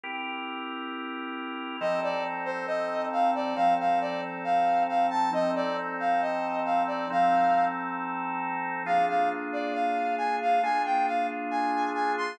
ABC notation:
X:1
M:4/4
L:1/8
Q:1/4=136
K:F
V:1 name="Brass Section"
z8 | _e d z c e2 f d | f f d z f2 f a | _e d z f e2 f d |
f3 z5 | f f z d f2 _a f | _a g f z a2 a c' |]
V:2 name="Drawbar Organ"
[CEGB]8 | [F,C_EA]8 | [F,C_EA]8 | [F,C_EA]8 |
[F,C_EA]8 | [B,DF_A]8 | [B,DF_A]8 |]